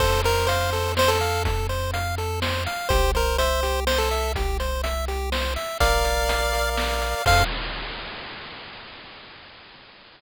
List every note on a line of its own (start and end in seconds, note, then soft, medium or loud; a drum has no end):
0.00 2.68 F2 medium
0.00 0.22 A4 loud
0.00 0.21 C5 medium
0.00 kick loud
0.00 crash medium
0.24 0.48 A#4 medium
0.24 0.46 C5 medium
0.24 closed hi-hat medium
0.47 0.92 C5 medium
0.47 0.70 F5 loud
0.47 closed hi-hat medium
0.73 0.94 A4 medium
0.73 closed hi-hat medium
0.97 1.19 C5 medium
0.97 1.10 C5 medium
0.97 snare loud
1.08 1.43 A4 medium
1.21 1.43 F5 medium
1.21 closed hi-hat medium
1.45 1.67 A4 medium
1.45 kick loud
1.45 closed hi-hat medium
1.69 1.91 C5 medium
1.69 closed hi-hat medium
1.94 2.15 F5 medium
1.94 closed hi-hat medium
2.18 2.40 A4 medium
2.18 closed hi-hat medium
2.42 2.64 C5 medium
2.42 snare loud
2.66 2.88 F5 medium
2.66 closed hi-hat medium
2.89 5.57 C2 medium
2.89 3.12 G4 loud
2.89 3.11 C5 medium
2.89 kick loud
2.89 closed hi-hat medium
3.15 3.38 A#4 medium
3.15 3.36 C5 medium
3.15 closed hi-hat medium
3.38 3.80 C5 medium
3.38 3.61 E5 medium
3.38 closed hi-hat medium
3.63 3.85 G4 medium
3.63 closed hi-hat medium
3.87 3.98 C5 medium
3.87 4.09 C5 medium
3.87 snare loud
3.98 4.32 A4 medium
4.11 4.33 E5 medium
4.11 closed hi-hat medium
4.35 4.58 G4 medium
4.35 kick loud
4.35 closed hi-hat medium
4.60 4.82 C5 medium
4.60 closed hi-hat medium
4.83 5.05 E5 medium
4.83 closed hi-hat medium
5.08 5.30 G4 medium
5.08 closed hi-hat medium
5.32 5.54 C5 medium
5.32 snare loud
5.56 5.78 E5 medium
5.56 closed hi-hat medium
5.80 7.15 A#1 medium
5.80 6.53 A#4 loud
5.80 6.70 D5 medium
5.80 6.70 F5 medium
5.80 kick loud
5.80 closed hi-hat loud
6.05 6.77 D5 medium
6.05 closed hi-hat medium
6.29 7.01 F5 loud
6.29 closed hi-hat loud
6.53 7.22 A#4 medium
6.53 closed hi-hat medium
6.77 7.23 D5 medium
6.77 snare loud
7.02 7.25 F5 medium
7.02 closed hi-hat medium
7.26 7.44 F2 loud
7.26 7.43 A4 loud
7.26 7.43 C5 loud
7.26 7.43 F5 loud
7.26 7.44 F5 loud
7.26 kick loud
7.26 crash loud